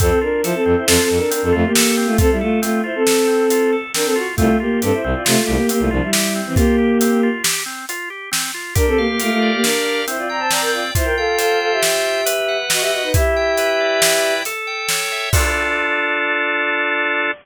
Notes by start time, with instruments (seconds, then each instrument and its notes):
0.00 violin F2 C4 A4, drawbar organ C4, kick, closed hi-hat
0.21 violin D4 A#4, drawbar organ F4
0.43 violin F3 E4 C5, drawbar organ A4, closed hi-hat
0.54 violin C4 A4
0.65 violin F2, drawbar organ C4
0.77 violin E4 C5
0.86 violin F2 C4 A4, drawbar organ F4, snare
1.02 violin C4 A4
1.10 violin F2, drawbar organ A4
1.17 violin D4 A#4
1.31 drawbar organ C4, violin D4 A#4, closed hi-hat
1.43 violin F2 C4 A4
1.52 violin F2 A3 F4, drawbar organ F4
1.66 violin A#3 G4
1.75 drawbar organ A4, snare
1.97 drawbar organ C4
2.06 violin A3 F4
2.18 violin C4 A4, drawbar organ F4, kick, closed hi-hat
2.31 violin G3 E4
2.41 violin A3 F4, drawbar organ A4
2.62 violin A3 F4, drawbar organ C4, closed hi-hat
2.84 violin E4 C5, drawbar organ F4
2.95 violin C4 A4
3.07 drawbar organ A4, snare
3.27 drawbar organ C4
3.50 drawbar organ F4, closed hi-hat
3.73 drawbar organ A4
3.94 drawbar organ C4, violin D4 A#4, snare
4.05 violin C4 A4
4.16 drawbar organ F4, violin F#4
4.36 violin C2 A3 F4, drawbar organ C4, kick, closed hi-hat
4.60 violin A#3 G4, drawbar organ F4
4.82 violin G2 C4 A4, drawbar organ G4, closed hi-hat
4.93 violin E4 C5
5.04 violin C2, drawbar organ C4
5.14 violin F4 D5
5.25 violin C3 A3 F4, drawbar organ F4, snare
5.41 violin A3 F4
5.47 violin C2, drawbar organ G4
5.55 violin A#3 G4
5.69 violin A#3 G4, drawbar organ C4, closed hi-hat
5.79 violin C2 A3 F4
5.91 violin C2 F3 D4, drawbar organ F4
6.02 violin G3 E4
6.13 drawbar organ G4, snare
6.35 drawbar organ C4
6.46 violin E3 C4
6.55 violin A#3 G4, drawbar organ F4, kick, closed hi-hat
6.78 drawbar organ G4
7.01 drawbar organ C4, closed hi-hat
7.23 drawbar organ F4
7.44 drawbar organ G4, snare
7.66 drawbar organ C4
7.89 drawbar organ F4, closed hi-hat
8.10 drawbar organ G4
8.31 drawbar organ C4, snare
8.54 drawbar organ F4
8.75 violin D4 A#4, drawbar organ G4, kick, closed hi-hat
8.87 violin C4 A4
8.98 violin A#3 G4, drawbar organ F5
9.08 violin A#3 G4
9.20 violin A3 F4, drawbar organ A#4, closed hi-hat
9.31 violin A3 F4
9.42 drawbar organ D5
9.53 violin A#3 G4
9.62 violin D4 A#4, drawbar organ G4, snare
9.85 drawbar organ F5
10.07 drawbar organ C4, violin E4 C5, closed hi-hat
10.17 violin F4 D5
10.29 violin D5 A#5, drawbar organ G5
10.39 violin C5 A5
10.51 violin D5 A#5, drawbar organ D5, snare
10.61 violin A#4 G5
10.73 violin F4 D5, drawbar organ G5
10.95 violin E4 C5, drawbar organ F4, kick, closed hi-hat
11.04 violin A#4 G5
11.17 violin A4 F5, drawbar organ G5
11.38 violin A4 F5, drawbar organ C5, closed hi-hat
11.60 violin A4 F5, drawbar organ G5
11.71 violin G4 E5
11.82 drawbar organ F4, snare
12.05 drawbar organ G5
12.26 drawbar organ B4, closed hi-hat
12.48 drawbar organ F#5
12.70 violin F#4 D#5, drawbar organ D#5, snare
12.81 violin G4 E5
12.92 violin F#4 D#5, drawbar organ F#5
13.03 violin D#4 B4
13.14 drawbar organ E4, violin G4 E5, kick, closed hi-hat
13.36 drawbar organ G5
13.57 drawbar organ B4, closed hi-hat
13.80 drawbar organ D5
14.02 drawbar organ E4, snare
14.23 drawbar organ G5
14.45 drawbar organ A4, closed hi-hat
14.67 drawbar organ G5
14.89 drawbar organ C#5, snare
15.12 drawbar organ E5
15.32 drawbar organ F4 A4, violin D5, kick, crash
15.36 drawbar organ D4